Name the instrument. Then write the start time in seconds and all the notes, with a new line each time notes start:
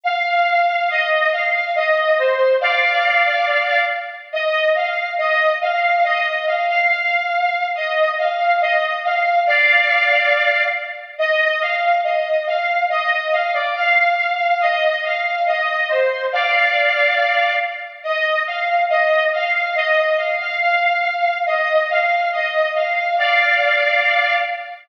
lead 1 (square)
0.03 F5
0.90 D#5
1.32 F5
1.76 D#5
2.18 C5
2.61 D5 F5
4.33 D#5
4.75 F5
5.18 D#5
5.61 F5
6.04 D#5
6.25 D#5
6.46 F5
6.68 F5
6.89 F5
7.75 D#5
8.18 F5
8.61 D#5
9.04 F5
9.47 D5 F5
11.18 D#5
11.61 F5
12.04 D#5
12.47 F5
12.89 D#5
13.11 D#5
13.32 F5
13.54 D5
13.75 F5
14.61 D#5
15.04 F5
15.46 D#5
15.89 C5
16.32 D5 F5
18.03 D#5
18.46 F5
18.89 D#5
19.33 F5
19.75 D#5
19.96 D#5
20.18 F5
20.39 F5
20.61 F5
21.46 D#5
21.89 F5
22.32 D#5
22.75 F5
23.18 D5 F5